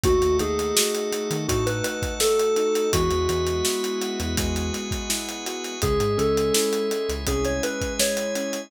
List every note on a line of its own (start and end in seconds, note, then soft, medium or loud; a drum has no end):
0.03 0.20 D#2 loud
0.03 1.12 A3 medium
0.03 0.37 F#4 loud
0.03 1.47 A4 medium
0.03 1.47 D#5 medium
0.03 1.47 F#5 medium
0.03 kick loud
0.03 closed hi-hat loud
0.22 0.38 D#2 loud
0.22 closed hi-hat medium
0.39 0.72 D#2 loud
0.39 1.48 D#4 medium
0.39 1.36 G#4 medium
0.39 closed hi-hat medium
0.59 closed hi-hat medium
0.75 1.84 F#4 medium
0.75 snare loud
0.95 closed hi-hat medium
1.12 2.19 A3 medium
1.12 closed hi-hat loud
1.30 1.47 D#3 loud
1.30 closed hi-hat medium
1.48 1.81 A2 loud
1.48 2.56 D#4 medium
1.48 1.66 F#4 medium
1.48 2.92 A4 medium
1.48 2.92 F#5 medium
1.48 2.92 A5 medium
1.48 kick loud
1.48 closed hi-hat loud
1.66 1.83 B4 medium
1.66 closed hi-hat medium
1.84 2.87 F#4 medium
1.84 2.14 B4 medium
1.84 closed hi-hat loud
2.02 kick loud
2.02 closed hi-hat medium
2.20 2.89 A3 medium
2.20 2.90 A4 loud
2.20 snare loud
2.39 closed hi-hat medium
2.56 2.91 D#4 medium
2.56 closed hi-hat medium
2.75 closed hi-hat medium
2.92 3.09 E2 loud
2.92 4.37 G#3 loud
2.92 4.19 F#4 loud
2.92 4.36 G#4 medium
2.92 4.36 B4 medium
2.92 4.36 E5 medium
2.92 4.36 F#5 medium
2.92 kick loud
2.92 closed hi-hat loud
3.11 3.27 E2 loud
3.11 closed hi-hat medium
3.28 3.62 E2 loud
3.28 4.72 B3 medium
3.28 closed hi-hat medium
3.47 closed hi-hat medium
3.65 5.09 E4 medium
3.65 snare loud
3.84 closed hi-hat medium
4.02 5.46 F#4 medium
4.02 closed hi-hat medium
4.20 4.36 E2 loud
4.20 closed hi-hat medium
4.37 4.70 E2 loud
4.37 5.75 G#3 loud
4.37 5.81 G#4 medium
4.37 5.81 B4 medium
4.37 5.81 F#5 medium
4.37 5.81 G#5 medium
4.37 kick loud
4.37 closed hi-hat loud
4.56 closed hi-hat medium
4.73 5.76 B3 medium
4.73 closed hi-hat medium
4.91 kick loud
4.91 closed hi-hat medium
5.09 5.78 E4 medium
5.09 snare loud
5.29 closed hi-hat medium
5.46 5.81 F#4 medium
5.46 closed hi-hat medium
5.64 closed hi-hat medium
5.82 5.98 C#2 loud
5.82 6.91 G#3 loud
5.82 7.25 G#4 medium
5.82 6.18 G#4 loud
5.82 7.25 C#5 medium
5.82 7.25 E5 medium
5.82 kick loud
5.82 closed hi-hat loud
6.00 6.16 G#2 medium
6.00 closed hi-hat medium
6.17 6.51 C#2 medium
6.17 7.27 C#4 medium
6.17 7.09 A4 medium
6.17 closed hi-hat medium
6.37 closed hi-hat medium
6.54 7.63 E4 medium
6.54 snare loud
6.73 closed hi-hat medium
6.91 7.99 G#3 medium
6.91 closed hi-hat medium
7.09 7.25 C#2 medium
7.09 closed hi-hat medium
7.27 7.59 C2 loud
7.27 8.35 C#4 medium
7.27 8.70 G#4 medium
7.27 7.45 G#4 medium
7.27 8.70 E5 medium
7.27 8.70 G#5 medium
7.27 kick medium
7.27 closed hi-hat loud
7.45 7.62 C#5 medium
7.45 closed hi-hat medium
7.63 8.66 E4 medium
7.63 7.94 B4 medium
7.63 closed hi-hat loud
7.81 kick loud
7.81 closed hi-hat medium
7.99 8.68 G#3 medium
7.99 8.62 C#5 medium
7.99 snare loud
8.17 closed hi-hat medium
8.35 8.70 C#4 medium
8.35 closed hi-hat medium
8.53 closed hi-hat medium